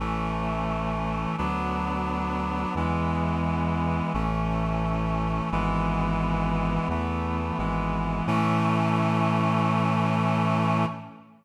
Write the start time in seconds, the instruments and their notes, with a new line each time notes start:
0.00 synth bass 1 A1, clarinet E3 A3 C#4
1.38 synth bass 1 D2, clarinet F#3 B3 D4
2.75 synth bass 1 E2, clarinet E3 G#3 B3
4.14 synth bass 1 A1, clarinet E3 A3 C#4
5.52 synth bass 1 G#1, clarinet E3 G#3 B3
6.89 synth bass 1 E2, clarinet E3 A3 B3
7.58 synth bass 1 G#1, clarinet E3 G#3 B3
8.27 synth bass 1 A2, clarinet E3 A3 C#4